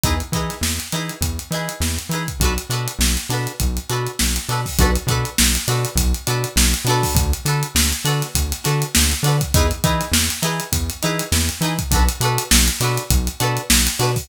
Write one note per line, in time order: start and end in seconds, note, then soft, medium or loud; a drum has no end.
0.04 0.22 E2 medium
0.04 0.15 D#4 loud
0.04 0.15 E4 medium
0.04 0.15 G#4 loud
0.04 0.15 B4 loud
0.04 kick loud
0.04 closed hi-hat medium
0.20 closed hi-hat medium
0.32 0.50 E3 medium
0.32 0.56 D#4 medium
0.32 0.56 E4 medium
0.32 0.56 G#4 medium
0.32 kick medium
0.32 closed hi-hat medium
0.37 0.56 B4 medium
0.50 snare soft
0.50 closed hi-hat medium
0.61 0.79 E2 medium
0.61 snare medium
0.80 snare soft
0.80 closed hi-hat medium
0.92 1.11 E3 medium
0.92 1.15 D#4 medium
0.92 1.15 E4 medium
0.92 1.15 G#4 medium
0.92 1.15 B4 medium
0.92 closed hi-hat medium
1.09 closed hi-hat medium
1.21 1.39 E2 medium
1.21 kick medium
1.21 closed hi-hat medium
1.39 closed hi-hat medium
1.51 1.69 E3 medium
1.51 1.74 D#4 medium
1.51 1.74 E4 medium
1.51 1.74 G#4 medium
1.51 snare soft
1.51 closed hi-hat medium
1.55 1.74 B4 medium
1.69 closed hi-hat medium
1.80 1.98 E2 medium
1.80 snare medium
1.99 closed hi-hat medium
2.09 2.27 E3 medium
2.09 2.23 D#4 medium
2.09 2.23 E4 medium
2.09 closed hi-hat medium
2.14 2.23 G#4 medium
2.14 2.23 B4 medium
2.28 kick medium
2.28 closed hi-hat medium
2.40 2.58 B1 medium
2.40 2.54 D4 medium
2.40 2.54 F#4 loud
2.40 kick medium
2.40 closed hi-hat medium
2.44 2.54 A4 loud
2.44 2.54 B4 medium
2.58 closed hi-hat medium
2.70 2.88 B2 medium
2.70 2.92 D4 medium
2.70 2.92 F#4 loud
2.70 2.92 A4 medium
2.70 closed hi-hat medium
2.74 2.92 B4 medium
2.88 closed hi-hat medium
2.99 3.17 B1 medium
2.99 snare loud
3.17 closed hi-hat medium
3.29 3.47 B2 medium
3.29 3.52 D4 medium
3.29 3.52 F#4 medium
3.29 3.52 A4 medium
3.29 snare soft
3.29 closed hi-hat medium
3.34 3.52 B4 medium
3.47 closed hi-hat medium
3.60 3.79 B1 medium
3.60 kick medium
3.60 closed hi-hat medium
3.77 closed hi-hat medium
3.89 4.08 B2 medium
3.89 4.11 D4 medium
3.89 4.11 F#4 medium
3.89 4.11 A4 medium
3.89 4.11 B4 medium
3.89 closed hi-hat medium
4.07 closed hi-hat medium
4.19 4.38 B1 medium
4.19 snare loud
4.36 closed hi-hat medium
4.49 4.67 B2 medium
4.49 4.61 D4 medium
4.49 4.61 F#4 medium
4.49 4.61 A4 medium
4.49 4.61 B4 medium
4.49 snare soft
4.49 closed hi-hat medium
4.66 kick medium
4.66 open hi-hat medium
4.79 4.97 B1 medium
4.79 4.91 D4 loud
4.79 4.91 F#4 loud
4.79 4.91 A4 loud
4.79 4.91 B4 loud
4.79 kick loud
4.79 closed hi-hat loud
4.96 closed hi-hat medium
5.07 5.25 B2 medium
5.07 5.30 D4 medium
5.07 5.30 F#4 medium
5.07 5.30 A4 loud
5.07 kick medium
5.07 closed hi-hat medium
5.11 5.30 B4 loud
5.25 closed hi-hat medium
5.38 5.57 B1 medium
5.38 snare loud
5.55 closed hi-hat medium
5.68 5.86 B2 medium
5.68 5.90 D4 loud
5.68 5.90 F#4 medium
5.68 5.90 A4 medium
5.68 5.90 B4 medium
5.68 snare soft
5.68 closed hi-hat medium
5.85 closed hi-hat medium
5.95 6.13 B1 medium
5.95 kick medium
5.95 closed hi-hat loud
6.14 closed hi-hat medium
6.27 6.45 B2 medium
6.27 6.49 D4 loud
6.27 6.49 F#4 medium
6.27 6.49 A4 loud
6.27 6.49 B4 medium
6.27 closed hi-hat medium
6.44 closed hi-hat medium
6.56 6.74 B1 medium
6.56 snare loud
6.74 closed hi-hat medium
6.85 7.03 B2 medium
6.85 7.29 D4 loud
6.85 7.29 F#4 loud
6.85 closed hi-hat medium
6.89 7.29 A4 loud
6.89 7.29 B4 loud
7.03 kick medium
7.03 snare soft
7.03 open hi-hat medium
7.15 7.33 D2 medium
7.15 kick loud
7.15 closed hi-hat loud
7.33 closed hi-hat medium
7.45 7.63 D3 medium
7.45 7.68 D4 medium
7.45 7.68 F#4 medium
7.45 7.68 A4 loud
7.45 7.68 B4 loud
7.45 snare soft
7.45 closed hi-hat medium
7.63 closed hi-hat medium
7.75 7.93 D2 medium
7.75 snare loud
7.93 closed hi-hat medium
8.05 8.23 D3 medium
8.05 8.27 D4 loud
8.05 8.27 F#4 medium
8.05 8.27 A4 loud
8.05 closed hi-hat medium
8.09 8.27 B4 loud
8.22 snare soft
8.22 closed hi-hat medium
8.35 8.53 D2 medium
8.35 kick medium
8.35 closed hi-hat loud
8.52 snare soft
8.52 closed hi-hat medium
8.64 8.84 D3 medium
8.64 8.86 D4 medium
8.64 8.86 F#4 loud
8.64 8.86 A4 loud
8.64 8.86 B4 medium
8.64 snare soft
8.64 closed hi-hat medium
8.82 closed hi-hat medium
8.95 9.14 D2 medium
8.95 snare loud
9.12 closed hi-hat medium
9.23 9.41 D3 medium
9.23 9.36 D4 medium
9.23 9.36 F#4 medium
9.23 9.36 A4 medium
9.23 closed hi-hat medium
9.28 9.36 B4 loud
9.41 kick medium
9.41 closed hi-hat medium
9.54 9.72 E2 medium
9.54 9.67 D#4 loud
9.54 9.67 E4 loud
9.54 9.67 G#4 loud
9.54 9.67 B4 loud
9.54 kick loud
9.54 closed hi-hat loud
9.71 closed hi-hat medium
9.84 10.02 E3 medium
9.84 10.06 D#4 loud
9.84 10.06 E4 medium
9.84 10.06 G#4 medium
9.84 10.06 B4 medium
9.84 kick medium
9.84 closed hi-hat medium
10.01 snare soft
10.01 closed hi-hat medium
10.12 10.30 E2 medium
10.12 snare loud
10.30 snare soft
10.30 closed hi-hat medium
10.42 10.61 E3 medium
10.42 10.64 D#4 medium
10.42 10.64 E4 loud
10.42 10.64 G#4 medium
10.42 10.64 B4 medium
10.42 closed hi-hat medium
10.60 closed hi-hat medium
10.72 10.90 E2 medium
10.72 kick medium
10.72 closed hi-hat loud
10.90 closed hi-hat medium
11.02 11.22 E3 medium
11.02 11.25 D#4 medium
11.02 11.25 E4 loud
11.02 11.25 G#4 loud
11.02 11.25 B4 loud
11.02 snare soft
11.02 closed hi-hat medium
11.19 closed hi-hat medium
11.32 11.50 E2 medium
11.32 snare loud
11.49 closed hi-hat medium
11.61 11.79 E3 medium
11.61 11.74 D#4 medium
11.61 11.74 E4 medium
11.61 11.74 G#4 loud
11.61 closed hi-hat medium
11.66 11.74 B4 medium
11.79 kick medium
11.79 closed hi-hat medium
11.91 12.09 B1 medium
11.91 12.04 D4 loud
11.91 12.04 F#4 loud
11.91 12.04 A4 loud
11.91 kick loud
11.91 closed hi-hat loud
11.96 12.04 B4 loud
12.09 closed hi-hat medium
12.20 12.38 B2 medium
12.20 12.44 D4 loud
12.20 12.44 F#4 loud
12.20 12.44 A4 loud
12.20 closed hi-hat medium
12.25 12.44 B4 loud
12.38 closed hi-hat medium
12.51 12.69 B1 medium
12.51 snare loud
12.68 closed hi-hat medium
12.80 12.98 B2 medium
12.80 13.03 D4 loud
12.80 13.03 F#4 loud
12.80 13.03 A4 medium
12.80 snare soft
12.80 closed hi-hat medium
12.85 13.03 B4 loud
12.98 closed hi-hat medium
13.11 13.29 B1 medium
13.11 kick loud
13.11 closed hi-hat loud
13.27 closed hi-hat medium
13.40 13.59 B2 medium
13.40 13.62 D4 medium
13.40 13.62 F#4 loud
13.40 13.62 A4 medium
13.40 13.62 B4 loud
13.40 closed hi-hat medium
13.57 closed hi-hat medium
13.70 13.88 B1 medium
13.70 snare loud
13.87 closed hi-hat medium
13.99 14.17 B2 medium
13.99 14.11 D4 loud
13.99 14.11 F#4 medium
13.99 14.11 A4 loud
13.99 14.11 B4 loud
13.99 snare soft
13.99 closed hi-hat medium
14.16 kick medium
14.16 open hi-hat medium